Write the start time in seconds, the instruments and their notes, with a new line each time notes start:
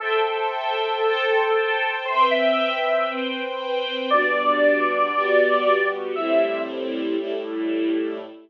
0.00 lead 2 (sawtooth) A4, string ensemble 1 A4 C5 E5 G5
1.04 string ensemble 1 A4 C5 G5 A5
2.05 string ensemble 1 C4 B4 E5 G5, lead 2 (sawtooth) C5
2.31 lead 2 (sawtooth) E5
3.07 string ensemble 1 C4 B4 C5 G5
4.09 string ensemble 1 G3 B3 D4 F#4, lead 2 (sawtooth) D5
5.13 string ensemble 1 G3 B3 F#4 G4
6.14 string ensemble 1 A2 G3 C4 E4, lead 2 (sawtooth) E5
7.17 string ensemble 1 A2 G3 A3 E4